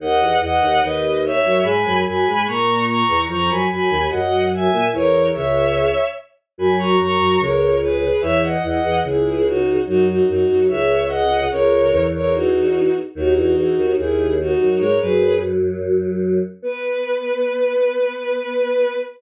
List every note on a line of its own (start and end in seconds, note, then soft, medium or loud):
0.00 0.20 D#2 medium
0.00 0.20 D#3 medium
0.00 0.35 D#5 medium
0.00 0.35 F#5 medium
0.21 0.40 E2 medium
0.21 0.40 E3 medium
0.41 0.60 E2 medium
0.41 0.60 E3 medium
0.41 0.80 D#5 medium
0.41 0.81 F#5 medium
0.61 0.79 D#2 medium
0.61 0.79 D#3 medium
0.80 1.38 D#2 medium
0.80 1.38 D#3 medium
0.80 1.18 B4 medium
0.80 1.18 D#5 medium
1.25 1.64 C#5 medium
1.25 1.64 E5 medium
1.43 1.60 F#2 medium
1.43 1.60 F#3 medium
1.63 1.84 G#2 medium
1.63 1.84 G#3 medium
1.63 1.97 G#5 medium
1.63 1.97 B5 medium
1.84 2.04 F#2 medium
1.84 2.04 F#3 medium
2.05 2.24 F#2 medium
2.05 2.24 F#3 medium
2.05 2.44 G#5 medium
2.05 2.44 B5 medium
2.27 2.46 G#2 medium
2.27 2.46 G#3 medium
2.46 3.03 A#2 medium
2.46 3.03 A#3 medium
2.46 2.83 A#5 medium
2.46 2.83 C#6 medium
2.87 3.20 A#5 medium
2.87 3.20 C#6 medium
3.08 3.26 E2 medium
3.08 3.26 E3 medium
3.29 3.49 F2 medium
3.29 3.49 F3 medium
3.29 3.49 A#5 medium
3.29 3.49 C#6 loud
3.49 3.66 F#2 medium
3.49 3.66 F#3 medium
3.49 3.67 G#5 medium
3.49 3.67 B5 medium
3.70 3.88 F#2 medium
3.70 3.88 F#3 medium
3.70 4.04 G#5 medium
3.70 4.04 B5 medium
3.90 4.07 D#2 medium
3.90 4.07 D#3 medium
4.09 4.68 F#2 medium
4.09 4.68 F#3 medium
4.09 4.42 D#5 medium
4.09 4.42 F#5 medium
4.54 4.87 E5 medium
4.54 4.87 G#5 medium
4.72 4.89 A#2 medium
4.72 4.89 A#3 medium
4.93 5.30 E2 medium
4.93 5.30 E3 medium
4.93 5.27 A#4 medium
4.93 5.27 C#5 loud
5.33 5.89 C#2 medium
5.33 5.89 C#3 medium
5.33 6.04 C#5 medium
5.33 6.04 E5 medium
6.58 6.96 F#2 medium
6.58 6.96 F#3 medium
6.58 6.76 G#5 medium
6.58 6.76 B5 medium
6.78 6.98 A#5 medium
6.78 6.98 C#6 medium
6.98 7.17 F#2 medium
6.98 7.17 F#3 medium
6.98 7.39 A#5 medium
6.98 7.39 C#6 medium
7.18 7.37 F#2 medium
7.18 7.37 F#3 medium
7.40 8.09 C#2 medium
7.40 8.09 C#3 medium
7.40 7.76 A#4 medium
7.40 7.76 C#5 medium
7.82 8.22 G#4 medium
7.82 8.22 B4 medium
8.21 8.57 E2 medium
8.21 8.57 E3 medium
8.21 8.39 C#5 medium
8.21 8.39 E5 loud
8.42 8.60 D#5 medium
8.42 8.60 F#5 medium
8.63 8.80 E2 medium
8.63 8.80 E3 medium
8.63 8.96 D#5 medium
8.63 8.96 F#5 medium
8.83 9.00 E2 medium
8.83 9.00 E3 medium
9.04 9.77 C#2 medium
9.04 9.77 C#3 medium
9.04 9.44 E4 medium
9.04 9.44 G#4 medium
9.46 9.79 D#4 medium
9.46 9.79 F#4 medium
9.86 10.21 F#2 medium
9.86 10.21 F#3 medium
9.86 10.04 D#4 medium
9.86 10.04 F#4 loud
10.07 10.26 D#4 medium
10.07 10.26 F#4 medium
10.28 10.45 F#2 medium
10.28 10.45 F#3 medium
10.28 10.63 D#4 medium
10.28 10.63 F#4 medium
10.49 10.68 F#2 medium
10.49 10.68 F#3 medium
10.68 11.45 C#2 medium
10.68 11.45 C#3 medium
10.68 11.03 C#5 medium
10.68 11.03 E5 medium
11.08 11.42 D#5 medium
11.08 11.42 F#5 medium
11.50 11.91 C#2 medium
11.50 11.91 C#3 medium
11.50 12.03 A#4 medium
11.50 12.03 C#5 medium
11.92 12.94 E2 medium
11.92 12.94 E3 medium
12.14 12.33 A#4 medium
12.14 12.33 C#5 medium
12.34 12.93 D#4 medium
12.34 12.93 F#4 medium
13.15 13.35 D#2 medium
13.15 13.35 D#3 medium
13.15 13.33 D#4 medium
13.15 13.33 F#4 loud
13.36 13.55 E2 medium
13.36 13.55 E3 medium
13.36 13.54 D#4 medium
13.36 13.54 F#4 medium
13.54 13.75 E2 medium
13.54 13.75 E3 medium
13.54 13.94 D#4 medium
13.54 13.94 F#4 medium
13.77 13.93 D#2 medium
13.77 13.93 D#3 medium
13.97 14.55 D#2 medium
13.97 14.55 D#3 medium
13.97 14.30 E4 medium
13.97 14.30 G#4 medium
14.40 14.80 D#4 medium
14.40 14.80 F#4 medium
14.59 14.77 F#2 medium
14.59 14.77 F#3 medium
14.78 14.99 G#2 medium
14.78 14.99 G#3 medium
14.78 14.97 A#4 medium
14.78 14.97 C#5 medium
15.00 16.39 F#2 medium
15.00 16.39 F#3 medium
15.00 15.37 G#4 medium
15.00 15.37 B4 medium
16.62 18.95 B3 loud
16.62 18.97 B4 loud